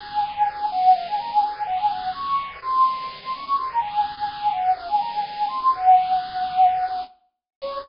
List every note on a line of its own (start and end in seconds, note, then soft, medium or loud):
0.00 0.32 G#5 loud
0.35 0.65 G#5 loud
0.72 0.93 F#5 loud
0.95 1.07 F5 loud
1.07 1.18 G#5 loud
1.19 1.30 A#5 medium
1.31 1.42 G#5 loud
1.43 1.63 G#5 loud
1.66 1.78 F#5 loud
1.79 1.90 G#5 loud
1.90 2.10 F#5 loud
2.14 2.56 C#6 loud
2.62 3.17 C6 loud
3.22 3.33 C6 loud
3.33 3.44 C#6 loud
3.45 3.56 C#6 loud
3.57 3.68 C6 medium
3.69 3.80 A#5 medium
3.81 4.12 G#5 loud
4.17 4.50 G#5 loud
4.52 4.72 F#5 medium
4.76 4.87 F5 loud
4.88 4.99 G#5 medium
5.00 5.11 A#5 loud
5.12 5.23 G#5 loud
5.24 5.46 G#5 loud
5.48 5.59 C6 loud
5.60 5.71 C6 medium
5.72 7.00 F#5 loud
7.62 7.78 C#5 loud